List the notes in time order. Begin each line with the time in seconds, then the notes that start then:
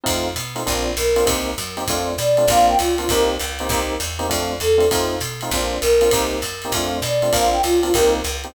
0.04 F2 A3 C4 D#4 F4, kick, ride
0.36 B2, hi-hat pedal, ride
0.55 A3 C4 D#4 F4, ride
0.66 A#1 A#3 C4 D4 F4, kick, ride
0.97 B1 A#4, hi-hat pedal, ride
1.16 A#3 C4 D4 F4, ride
1.26 C2 A#3 C4 D#4 G4, kick, ride
1.58 F#2, hi-hat pedal, ride
1.77 A#3 C4 D#4 G4, ride
1.88 F2 A3 C4 D4 F4, kick, ride
2.18 B2 D5, hi-hat pedal, ride
2.37 A3 C4 D4 F4, ride
2.48 A#1 A#3 C4 D4 F4 F5, kick, ride
2.68 G5
2.78 C#2 F4, hi-hat pedal, ride
2.98 A#3 C4 D4 F4, ride
3.09 C2 A#3 C4 D#4 G4 A#4, kick, ride
3.39 C#2, hi-hat pedal, ride
3.59 A#3 C4 D#4 G4, ride
3.69 C2 A#3 C4 D#4 G4, kick, ride
4.00 E2, hi-hat pedal, ride
4.19 A#3 C4 D#4 G4, ride
4.29 F2 A3 C4 D4 F4, kick, ride
4.60 E2 A4, hi-hat pedal, ride
4.78 A3 C4 D4 F4, ride
4.91 F2 A3 C4 D#4 F4, kick, ride
5.20 B2, hi-hat pedal, ride
5.41 A3 C4 D#4 F4, ride
5.51 A#1 A#3 C4 D4 F4, kick, ride
5.81 B1 A#4, hi-hat pedal, ride
6.01 A#3 C4 D4 F4, ride
6.11 C2 A#3 C4 D#4 G4, kick, ride
6.42 F#2, hi-hat pedal, ride
6.62 A#3 C4 D#4 G4, ride
6.72 F2 A3 C4 D4 F4, kick, ride
7.02 B2 D5, hi-hat pedal, ride
7.22 A3 C4 D4 F4, ride
7.32 A#1 A#3 C4 D4 F4 F5, kick, ride
7.53 G5
7.63 C#2 F4, hi-hat pedal, ride
7.83 A#3 C4 D4 F4, ride
7.94 C2 A#3 C4 D#4 G4 A#4, kick, ride
8.24 C#2, hi-hat pedal, ride
8.44 A#3 C4 D#4 G4, ride